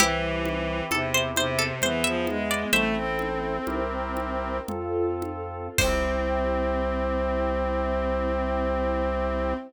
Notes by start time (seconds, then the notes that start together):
0.00 C2 E3 C4 E4 G4, low conga
0.45 high conga
0.91 E2 C3 C4 G4 A4 C5, high conga
1.14 C5
1.36 C3 C5, high conga
1.59 A4
1.82 E2 E3 B3 E4 G#4 C5, low conga
2.04 F3 E5
2.27 G#3, high conga
2.51 D5
2.73 A1 A3 C4 E4 A4 C5 E5, low conga
2.96 C4
3.19 high conga
3.67 C2 C4 E4 G4 A#4, high conga
4.17 high conga
4.68 F2 C4 F4 A4, low conga
5.22 high conga
5.78 C2 C4 E4 G4 C5, kick, crash